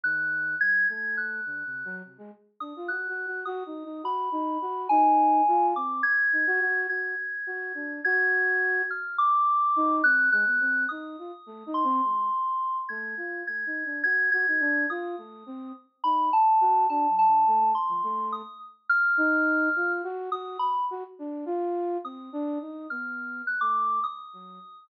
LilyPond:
<<
  \new Staff \with { instrumentName = "Flute" } { \time 7/8 \partial 4. \tempo 4 = 105 ees4 ges8 | a4 \tuplet 3/2 { d8 c8 ges8 } c16 aes16 r8 d'16 f'16 | \tuplet 3/2 { ges'8 ges'8 ges'8 ges'8 ees'8 ees'8 } ges'8 ees'8 ges'8 | ees'4 f'8 c'8 r8 ees'16 ges'16 ges'8 |
ges'8 r8 ges'8 d'8 ges'4. | r4. ees'8 c'8 aes16 b16 c'8 | ees'8 f'16 r16 \tuplet 3/2 { a8 ees'8 c'8 } aes8 r4 | a8 f'8 \tuplet 3/2 { a8 ees'8 d'8 } ges'8 ges'16 ees'16 d'8 |
f'8 a8 c'8 r8 ees'8 r8 ges'8 | \tuplet 3/2 { d'8 ges8 d8 } a16 a16 r16 f16 a8. r8. | r8 ees'4 f'8 ges'8 ges'8 r8 | ges'16 r16 d'8 f'4 c'8 d'8 ees'8 |
b4 r16 a8. r8 ges8 r8 | }
  \new Staff \with { instrumentName = "Electric Piano 2" } { \time 7/8 \partial 4. ges'''4 aes'''8 | aes'''8 ges'''4. r4 ees'''8 | ges'''4 ees'''4 b''4. | aes''4. d'''8 aes'''4. |
aes'''2 aes'''4. | f'''8 d'''4. ges'''8 ges'''4 | ees'''4. c'''2 | aes'''4 aes'''4 aes'''8 aes'''4 |
ees'''4. r8 b''8 a''4 | a''8 a''4 c'''4 ees'''8 r8 | f'''2 r8 ees'''8 b''8 | r2 ees'''4. |
f'''4 ges'''16 d'''8. ees'''4. | }
>>